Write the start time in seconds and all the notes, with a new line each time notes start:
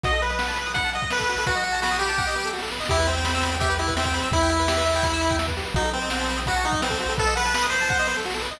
0.03 B1 F#4 D#5, kick, closed hi-hat
0.13 A4, closed hi-hat
0.22 B4, closed hi-hat
0.30 D#5, closed hi-hat
0.39 F#5, snare
0.48 A5, closed hi-hat
0.56 B5, closed hi-hat
0.66 D#6, closed hi-hat
0.74 F#5 B5, kick, closed hi-hat
0.84 A5, closed hi-hat
0.93 D#5 F#5, closed hi-hat
1.02 D#5, kick, closed hi-hat
1.10 B4, snare
1.19 A4, kick, closed hi-hat
1.29 F#4, closed hi-hat
1.37 A4, open hi-hat
1.46 B1 F#4 B4, kick, closed hi-hat
1.55 D#5, closed hi-hat
1.64 F#5, closed hi-hat
1.72 A5, closed hi-hat
1.82 F#4 B5, snare
1.91 D#6, closed hi-hat
1.99 G4 B5, closed hi-hat
2.09 A5, closed hi-hat
2.18 F#5, kick, snare
2.26 D#5, snare
2.35 B4, snare
2.44 A4, snare
2.53 F#4, snare
2.58 snare
2.62 A4, snare
2.68 snare
2.72 B4, snare
2.76 snare
2.80 D#5, snare
2.85 G4, kick, snare
2.90 E2 E4, closed hi-hat
2.97 B4, closed hi-hat
3.07 C4 E5, closed hi-hat
3.17 G5, closed hi-hat
3.25 B5, snare
3.34 E6, closed hi-hat
3.43 B5, closed hi-hat
3.51 G5, closed hi-hat
3.60 G4 E5, kick, closed hi-hat
3.70 B4, closed hi-hat
3.78 E4 G4, closed hi-hat
3.87 B4, kick, closed hi-hat
3.96 C4 E5, snare
4.05 G5, kick, closed hi-hat
4.14 B5, closed hi-hat
4.22 E6, closed hi-hat
4.31 E2 E4 B5, kick, closed hi-hat
4.41 G5, closed hi-hat
4.49 E5, closed hi-hat
4.59 B4, closed hi-hat
4.68 G4, snare
4.77 B4, closed hi-hat
4.86 E5, closed hi-hat
4.95 G5, closed hi-hat
5.03 B5, kick, closed hi-hat
5.13 E6, closed hi-hat
5.21 B5, closed hi-hat
5.30 G5, kick, closed hi-hat
5.38 E5, snare
5.48 B4, kick, closed hi-hat
5.57 G4, closed hi-hat
5.65 B4, closed hi-hat
5.74 B1 D#4 F#4, kick, closed hi-hat
5.84 A4, closed hi-hat
5.93 C4 B4, closed hi-hat
6.01 D#5, closed hi-hat
6.10 F#5, snare
6.20 A5, closed hi-hat
6.29 B5, closed hi-hat
6.37 D#6, closed hi-hat
6.46 F#4 B5, kick, closed hi-hat
6.56 A5, closed hi-hat
6.64 D#4 F#5, closed hi-hat
6.72 D#5, kick, closed hi-hat
6.82 C4 B4, snare
6.90 A4, kick, closed hi-hat
7.00 F#4, closed hi-hat
7.09 A4, open hi-hat
7.18 B1 A4 B4, kick, closed hi-hat
7.26 D#5, closed hi-hat
7.35 B4 F#5, closed hi-hat
7.45 A5, closed hi-hat
7.54 B5, snare
7.62 D#6, closed hi-hat
7.70 C5 B5, closed hi-hat
7.81 A5, closed hi-hat
7.89 F#5, kick, snare
7.99 D#5, snare
8.07 B4, snare
8.16 A4, snare
8.25 F#4, snare
8.30 snare
8.34 A4, snare
8.40 B4, snare
8.43 snare
8.47 snare
8.51 D#5, snare
8.57 snare